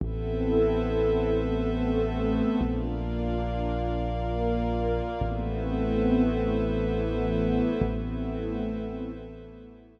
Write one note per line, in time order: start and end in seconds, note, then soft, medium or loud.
0.00 2.41 A1 medium
0.00 1.29 B3 medium
0.00 1.29 C4 medium
0.00 1.29 E4 medium
0.00 1.29 A4 medium
0.00 2.59 A4 medium
0.00 2.59 B4 medium
0.00 2.59 C5 medium
0.00 2.59 E5 loud
1.31 2.60 A3 medium
1.31 2.60 B3 medium
1.31 2.60 C4 medium
1.31 2.60 A4 medium
2.60 5.01 A#1 medium
2.60 3.89 A#3 medium
2.60 3.89 D4 medium
2.60 3.89 F4 medium
2.60 5.19 A#4 medium
2.60 5.19 D5 medium
2.60 5.19 F5 medium
3.91 5.21 A#3 loud
3.91 5.21 F4 medium
3.91 5.21 A#4 medium
5.21 7.61 A1 medium
5.21 6.51 A3 medium
5.21 6.51 B3 medium
5.21 6.51 C4 medium
5.21 6.51 E4 medium
5.21 7.80 A4 medium
5.21 7.80 B4 loud
5.21 7.80 C5 medium
5.21 7.80 E5 medium
6.51 7.80 E3 medium
6.51 7.80 A3 medium
6.51 7.80 B3 medium
6.51 7.80 E4 medium
7.82 10.00 A1 loud
7.82 9.12 A3 medium
7.82 9.12 B3 medium
7.82 9.12 C4 medium
7.82 9.12 E4 medium
7.82 10.00 A4 loud
7.82 10.00 B4 medium
7.82 10.00 C5 medium
7.82 10.00 E5 loud
9.14 10.00 E3 medium
9.14 10.00 A3 medium
9.14 10.00 B3 medium
9.14 10.00 E4 medium